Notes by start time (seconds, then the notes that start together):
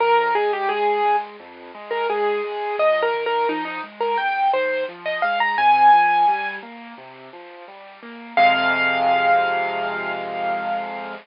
0.00 F2 A#4
0.35 G#3 G#4
0.53 G4
0.69 G#3 G#4
1.05 G#3
1.40 F2
1.75 G#3
1.91 A#4
2.09 G#3 G#4
2.44 G#3
2.79 C#2 D#5
3.02 A#4
3.14 D#3
3.26 A#4
3.49 F3 D#4
3.65 D#4
3.83 G#3
4.00 A#4
4.18 C#2 G5
4.53 D#3 C5
4.89 F3
5.06 D#5
5.22 G#3 F5
5.40 A#5
5.58 C3 G#5
5.93 F3
6.28 G3
6.62 A#3
6.98 C3
7.33 F3
7.68 G3
8.03 A#3
8.37 F2 C3 G#3 F5